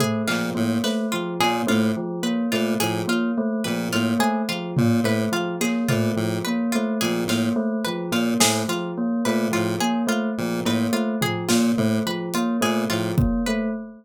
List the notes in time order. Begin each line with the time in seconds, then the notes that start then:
0.00 A3 G#4, floor tom
0.28 A#2 F3 F4, clap
0.55 A2 A#3
0.84 A3 B4, snare
1.12 F3 F4
1.40 A#2 A#3 G#4, cowbell
1.67 A2 A3 F4, high tom
1.97 F3
2.23 A#3 B4
2.52 A#2 A3 F4
2.80 A2 F3 G#4, closed hi-hat
3.07 A#3 F4
3.38 A3
3.64 A#2 F3 B4
3.92 A2 A#3 F4
4.19 A3 G#4
4.49 F3 F4
4.77 A#2 A#3, floor tom
5.04 A2 A3 B4
5.32 F3 F4
5.61 A#3 G#4, clap
5.88 A#2 A3 F4, floor tom
6.16 A2 F3
6.45 A#3 B4
6.72 A3 F4
7.01 A#2 F3 G#4, closed hi-hat
7.27 A2 A#3 F4, snare
7.56 A3
7.85 F3 B4
8.12 A#2 A#3 F4
8.40 A2 A3 G#4, snare
8.68 F3 F4
8.98 A#3
9.25 A#2 A3 B4
9.51 A2 F3 F4
9.80 A#3 G#4
10.07 A3 F4
10.38 A#2 F3
10.65 A2 A#3 B4, cowbell
10.93 A3 F4
11.21 F3 G#4, floor tom
11.49 A#2 A#3 F4, snare
11.78 A2 A3, floor tom
12.06 F3 B4
12.34 A#3 F4, closed hi-hat
12.61 A#2 A3 G#4
12.90 A2 F3 F4
13.18 A#3, kick
13.46 A3 B4